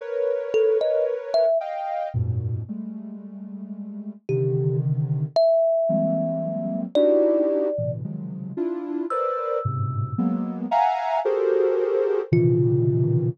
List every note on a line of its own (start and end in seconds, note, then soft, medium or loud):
0.01 1.45 A#4 medium
0.01 1.45 B4 medium
0.01 1.45 C#5 medium
0.54 0.78 A4 loud
0.81 1.05 D#5 medium
1.34 1.58 E5 loud
1.60 2.09 D#5 medium
1.60 2.09 F5 medium
1.60 2.09 G5 medium
2.14 2.62 F#2 loud
2.14 2.62 G#2 loud
2.14 2.62 A#2 loud
2.14 2.62 B2 loud
2.68 4.13 G3 medium
2.68 4.13 G#3 medium
2.68 4.13 A3 medium
4.29 5.26 C3 loud
4.29 5.26 D3 loud
4.29 5.26 D#3 loud
4.29 4.77 G4 medium
5.36 6.81 E5 loud
5.89 6.85 E3 medium
5.89 6.85 F#3 medium
5.89 6.85 G3 medium
5.89 6.85 G#3 medium
5.89 6.85 A#3 medium
5.89 6.85 C4 medium
6.95 7.68 D4 medium
6.95 7.68 D#4 medium
6.95 7.68 E4 medium
6.95 7.68 F#4 medium
6.95 7.68 G4 medium
6.95 7.92 D5 loud
7.78 8.02 A2 medium
7.78 8.02 A#2 medium
7.78 8.02 B2 medium
7.78 8.02 C3 medium
7.78 8.02 D3 medium
7.78 8.02 E3 medium
8.04 8.52 C3 medium
8.04 8.52 C#3 medium
8.04 8.52 D#3 medium
8.04 8.52 F3 medium
8.04 8.52 F#3 medium
8.04 8.52 G#3 medium
8.57 9.05 D4 loud
8.57 9.05 E4 loud
8.57 9.05 F4 loud
9.10 9.59 A#4 medium
9.10 9.59 B4 medium
9.10 9.59 C5 medium
9.10 9.59 D5 medium
9.10 10.55 E6 medium
9.65 10.13 G2 medium
9.65 10.13 G#2 medium
9.65 10.13 A2 medium
9.65 10.13 B2 medium
9.65 10.13 C3 medium
10.18 10.66 F#3 loud
10.18 10.66 G#3 loud
10.18 10.66 A#3 loud
10.18 10.66 B3 loud
10.71 11.19 E5 loud
10.71 11.19 F5 loud
10.71 11.19 F#5 loud
10.71 11.19 G#5 loud
10.71 11.19 A#5 loud
11.25 12.21 F#4 loud
11.25 12.21 G4 loud
11.25 12.21 G#4 loud
11.25 12.21 A4 loud
11.25 12.21 A#4 loud
11.25 12.21 C5 loud
12.32 13.28 A#2 loud
12.32 13.28 B2 loud
12.32 13.28 C3 loud
12.32 13.28 C#3 loud
12.32 13.28 D#3 loud
12.32 13.28 E3 loud
12.32 13.29 F4 medium